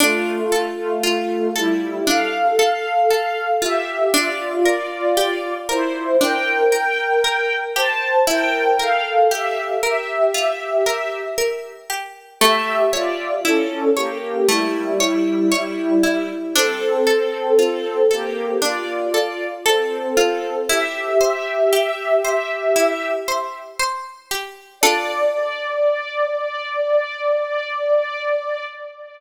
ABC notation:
X:1
M:4/4
L:1/16
Q:1/4=58
K:Dm
V:1 name="String Ensemble 1"
[A,F]3 [A,F]3 [G,E]2 [Af]6 [Ge]2 | [Fd]3 [Fd]3 [Ec]2 [Bg]6 [ca]2 | [Bg]2 [Af]2 [Ge]2 [Ge]6 z4 | [Ge]2 [Fd]2 [^CA]2 [B,G]2 [G,E]8 |
[CA]6 [B,G]2 [Fd]4 [CA]4 | [Ge]10 z6 | d16 |]
V:2 name="Harpsichord"
D2 A2 F2 A2 D2 A2 A2 F2 | D2 B2 G2 B2 D2 B2 B2 G2 | E2 B2 G2 B2 F2 B2 B2 G2 | A,2 ^c2 E2 c2 A,2 c2 c2 E2 |
D2 A2 F2 A2 D2 A2 A2 F2 | E2 c2 G2 c2 E2 c2 c2 G2 | [DFA]16 |]